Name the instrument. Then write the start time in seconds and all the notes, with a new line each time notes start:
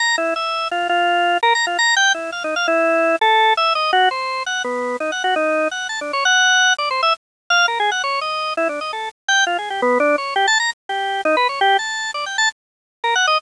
drawbar organ
0.00 A#5
0.18 E4
0.36 E5
0.71 F4
0.89 F4
1.43 A#4
1.55 A#5
1.67 F4
1.79 A#5
1.96 G5
2.14 E4
2.32 F5
2.44 D#4
2.56 F5
2.68 E4
3.21 A4
3.57 E5
3.75 D#5
3.93 F#4
4.11 C5
4.46 F#5
4.64 B3
5.00 D#4
5.12 F#5
5.24 F#4
5.36 D#4
5.71 F#5
5.89 A5
6.01 D4
6.13 C#5
6.25 F#5
6.78 D5
6.91 C5
7.03 E5
7.50 F5
7.68 A#4
7.80 G#4
7.92 F#5
8.04 C#5
8.21 D#5
8.57 E4
8.69 D4
8.81 D#5
8.93 A4
9.28 G5
9.47 F4
9.58 G#4
9.70 G4
9.82 B3
10.00 D4
10.18 C#5
10.36 G4
10.47 A5
10.60 A#5
10.89 G4
11.25 D#4
11.37 B4
11.49 C#5
11.61 G4
11.79 A5
12.14 D5
12.26 G5
12.38 A5
13.04 A#4
13.15 F#5
13.27 D#5